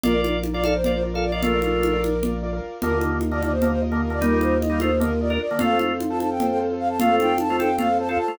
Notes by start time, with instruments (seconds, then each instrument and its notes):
0.03 drawbar organ A#1 F4 D5, acoustic grand piano F4 A#4 D5, flute A#4, low conga
0.14 acoustic grand piano F4 A#4 D5
0.24 high conga
0.44 high conga
0.54 acoustic grand piano F4 A#4 D5, drawbar organ F4 D5, flute D5
0.64 drawbar organ A4 F5, flute D5, high conga
0.75 flute C5
0.84 acoustic grand piano F4 A#4 D5, drawbar organ F4 D5, low conga
0.93 flute C5
1.03 acoustic grand piano F4 A#4 D5
1.14 acoustic grand piano F4 A#4 D5, drawbar organ A4 F5
1.23 flute D5
1.32 drawbar organ F4 D5, flute D#5
1.43 drawbar organ A3 F4, flute A#4, low conga
1.53 acoustic grand piano F4 A#4 D5
1.62 drawbar organ A3 F4, high conga
1.83 high conga
1.93 acoustic grand piano F4 A#4 D5
2.04 high conga
2.23 acoustic grand piano F4 A#4 D5, low conga
2.43 acoustic grand piano F4 A#4 D5
2.53 acoustic grand piano F4 A#4 D5
2.81 drawbar organ D#2 D3 A#3, acoustic grand piano F4 A#4 D#5, flute A#4, low conga
2.93 acoustic grand piano F4 A#4 D#5
3.01 high conga
3.21 high conga
3.31 drawbar organ D3 A#3, acoustic grand piano F4 A#4 D#5, flute D5
3.42 drawbar organ D3 A#3, flute D5, high conga
3.51 flute C5
3.62 drawbar organ D3 A#3, acoustic grand piano F4 A#4 D#5, low conga
3.71 flute C5
3.82 acoustic grand piano F4 A#4 D#5
3.92 drawbar organ D3 A#3, acoustic grand piano F4 A#4 D#5
4.03 flute A#4
4.10 drawbar organ D3 A#3, flute D5
4.21 drawbar organ G3 D#4, flute A#4, low conga
4.31 acoustic grand piano F4 A#4 D#5
4.41 flute C5, high conga
4.61 flute D#5, high conga
4.70 drawbar organ G3 D#4, acoustic grand piano F4 A#4 D#5
4.80 drawbar organ A3 F4, flute C5, high conga
5.00 drawbar organ D3 A#3, acoustic grand piano F4 A#4 D#5, flute A#4, low conga
5.21 acoustic grand piano F4 A#4 D#5, flute D5
5.30 drawbar organ D4 A#4, acoustic grand piano F4 A#4 D#5, flute A#4
5.41 flute D5
5.51 drawbar organ D3 A#3
5.59 drawbar organ F2 A3 F4, acoustic grand piano F4 A4 C5, flute F5, low conga
5.70 acoustic grand piano F4 A4 C5
5.79 high conga
6.00 high conga
6.10 acoustic grand piano F4 A4 C5, flute A5
6.20 flute A5, high conga
6.31 flute G5
6.40 acoustic grand piano F4 A4 C5, low conga
6.50 flute G5
6.60 acoustic grand piano F4 A4 C5
6.70 acoustic grand piano F4 A4 C5
6.79 flute F5
6.89 flute A5
6.99 drawbar organ A3 F4, flute F5, low conga
7.09 acoustic grand piano F4 A4 C5
7.20 flute G5, high conga
7.38 flute A5, high conga
7.49 drawbar organ A3 F4, acoustic grand piano F4 A4 C5
7.59 drawbar organ C4 A4, flute G5, high conga
7.78 drawbar organ A3 F4, acoustic grand piano F4 A4 C5, flute F5, low conga
7.99 acoustic grand piano F4 A4 C5, flute A5
8.08 drawbar organ C4 A4, acoustic grand piano F4 A4 C5, flute F5
8.18 flute A5
8.28 drawbar organ A3 F4